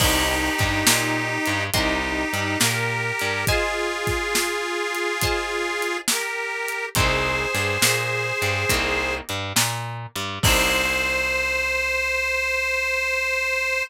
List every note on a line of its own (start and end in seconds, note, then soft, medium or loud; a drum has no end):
0.00 0.50 C2 loud
0.00 1.64 D#4 medium
0.00 1.64 G4 medium
0.00 0.52 A#4 loud
0.00 0.52 C5 loud
0.00 0.52 D#5 loud
0.00 0.52 G5 loud
0.00 kick medium
0.00 crash loud
0.59 0.83 G2 loud
0.59 0.82 G3 medium
0.59 kick medium
0.59 snare medium
0.59 closed hi-hat medium
0.87 1.38 A#2 loud
0.87 1.38 A#3 medium
0.87 snare loud
1.46 1.70 G2 loud
1.46 1.70 G3 medium
1.46 closed hi-hat medium
1.74 2.24 C2 loud
1.74 2.59 D#4 medium
1.74 2.59 G4 medium
1.74 2.28 A#4 loud
1.74 2.28 C5 loud
1.74 2.28 D#5 loud
1.74 2.28 G5 loud
1.74 kick medium
1.74 closed hi-hat loud
2.33 2.57 G2 medium
2.33 2.58 G3 medium
2.33 closed hi-hat medium
2.60 3.12 A#2 loud
2.60 3.11 A#3 medium
2.60 3.45 G4 medium
2.60 3.45 A#4 medium
2.60 snare loud
3.19 3.45 G2 medium
3.19 3.44 G3 medium
3.19 closed hi-hat medium
3.47 5.97 F4 medium
3.47 5.97 G#4 medium
3.47 4.30 C5 loud
3.47 4.30 D#5 loud
3.47 4.30 F5 loud
3.47 4.30 G#5 loud
3.47 kick medium
3.47 closed hi-hat medium
4.07 kick medium
4.07 snare soft
4.07 closed hi-hat medium
4.35 snare loud
4.95 closed hi-hat medium
5.22 6.05 C5 loud
5.22 6.05 D#5 loud
5.22 6.05 F5 loud
5.22 6.05 G#5 loud
5.22 kick medium
5.22 closed hi-hat loud
5.82 closed hi-hat medium
6.08 6.85 G4 medium
6.08 6.85 A#4 medium
6.08 snare loud
6.68 closed hi-hat medium
6.95 7.46 C2 loud
6.95 7.50 A#3 loud
6.95 7.50 C4 loud
6.95 7.50 D#4 loud
6.95 7.50 G4 loud
6.95 9.15 G#4 medium
6.95 9.15 C5 medium
6.95 kick loud
6.95 closed hi-hat loud
7.55 7.78 G2 medium
7.55 7.79 G3 medium
7.55 snare medium
7.55 closed hi-hat medium
7.82 8.32 A#2 loud
7.82 8.34 A#3 medium
7.82 snare loud
8.42 8.65 G2 loud
8.42 8.66 G3 medium
8.42 closed hi-hat medium
8.69 9.21 C2 loud
8.69 9.23 A#3 loud
8.69 9.23 C4 loud
8.69 9.23 D#4 loud
8.69 9.23 G4 loud
8.69 kick medium
8.69 closed hi-hat loud
9.29 9.53 G2 medium
9.29 9.52 G3 medium
9.29 closed hi-hat medium
9.56 10.07 A#2 loud
9.56 10.08 A#3 medium
9.56 snare loud
10.15 10.39 G2 medium
10.15 10.40 G3 medium
10.15 closed hi-hat medium
10.43 13.82 C2 loud
10.43 13.84 A#3 loud
10.43 13.84 C4 loud
10.43 13.84 D#4 loud
10.43 13.84 G4 loud
10.43 13.83 C5 loud
10.43 kick loud
10.43 crash loud